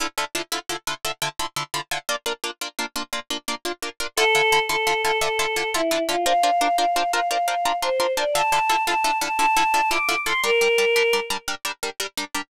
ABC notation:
X:1
M:12/8
L:1/8
Q:3/8=115
K:Dm
V:1 name="Choir Aahs"
z12 | z12 | A3 A2 A A3 E2 F | f3 f2 f f3 c2 d |
a3 a2 a a3 d'2 c' | B5 z7 |]
V:2 name="Orchestral Harp"
[D,EFA] [D,EFA] [D,EFA] [D,EFA] [D,EFA] [D,EFA] [D,EFA] [D,EFA] [D,EFA] [D,EFA] [D,EFA] [D,EFA] | [B,DF] [B,DF] [B,DF] [B,DF] [B,DF] [B,DF] [B,DF] [B,DF] [B,DF] [B,DF] [B,DF] [B,DF] | [D,EFA] [D,EFA] [D,EFA] [D,EFA] [D,EFA] [D,EFA] [D,EFA] [D,EFA] [D,EFA] [D,EFA] [D,EFA] [D,EFA] | [DFBc] [DFBc] [DFBc] [DFBc] [DFBc] [DFBc] [DFBc] [DFBc] [DFBc] [DFBc] [DFBc] [DFBc] |
[D,EFA] [D,EFA] [D,EFA] [D,EFA] [D,EFA] [D,EFA] [D,EFA] [D,EFA] [D,EFA] [D,EFA] [D,EFA] [D,EFA] | [G,DB] [G,DB] [G,DB] [G,DB] [G,DB] [G,DB] [G,DB] [G,DB] [G,DB] [G,DB] [G,DB] [G,DB] |]